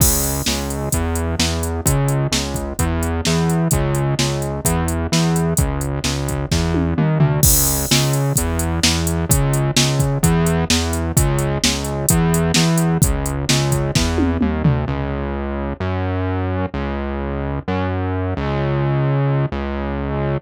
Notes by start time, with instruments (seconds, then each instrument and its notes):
0.00 synth bass 1 C#2, kick, crash
0.24 closed hi-hat
0.46 synth bass 1 C#2, snare
0.70 closed hi-hat
0.92 synth bass 1 E2, kick, closed hi-hat
1.16 closed hi-hat
1.39 synth bass 1 E2, snare
1.63 closed hi-hat
1.86 synth bass 1 C#2, kick, closed hi-hat
2.08 closed hi-hat
2.32 synth bass 1 C#2, snare
2.54 kick, closed hi-hat
2.79 synth bass 1 E2, kick, closed hi-hat
3.03 closed hi-hat
3.25 synth bass 1 E2, snare
3.50 closed hi-hat
3.71 synth bass 1 C#2, kick, closed hi-hat
3.95 closed hi-hat
4.19 synth bass 1 C#2, snare
4.42 closed hi-hat
4.65 synth bass 1 E2, kick, closed hi-hat
4.88 closed hi-hat
5.12 synth bass 1 E2, snare
5.36 closed hi-hat
5.57 synth bass 1 C#2, kick, closed hi-hat
5.81 closed hi-hat
6.04 synth bass 1 C#2, snare
6.28 kick, closed hi-hat
6.52 synth bass 1 E2, kick, snare
6.74 high tom
6.98 synth bass 1 D#2, mid tom
7.20 synth bass 1 D2, floor tom
7.43 synth bass 1 C#2, kick, crash
7.67 closed hi-hat
7.91 synth bass 1 C#2, snare
8.13 closed hi-hat
8.36 synth bass 1 E2, kick, closed hi-hat
8.59 closed hi-hat
8.83 synth bass 1 E2, snare
9.07 closed hi-hat
9.29 synth bass 1 C#2, kick, closed hi-hat
9.53 closed hi-hat
9.77 synth bass 1 C#2, snare
10.00 kick, closed hi-hat
10.23 synth bass 1 E2, kick, closed hi-hat
10.47 closed hi-hat
10.70 synth bass 1 E2, snare
10.93 closed hi-hat
11.17 synth bass 1 C#2, kick, closed hi-hat
11.39 closed hi-hat
11.64 synth bass 1 C#2, snare
11.84 closed hi-hat
12.09 synth bass 1 E2, kick, closed hi-hat
12.34 closed hi-hat
12.54 synth bass 1 E2, snare
12.78 closed hi-hat
13.02 synth bass 1 C#2, kick, closed hi-hat
13.26 closed hi-hat
13.49 synth bass 1 C#2, snare
13.72 kick, closed hi-hat
13.95 synth bass 1 E2, kick, snare
14.18 high tom
14.41 synth bass 1 D#2, mid tom
14.64 synth bass 1 D2, floor tom
14.88 synth bass 1 C#2
15.80 synth bass 1 F#2
16.74 synth bass 1 C#2
17.68 synth bass 1 F#2
18.37 synth bass 1 C#2
19.52 synth bass 1 C#2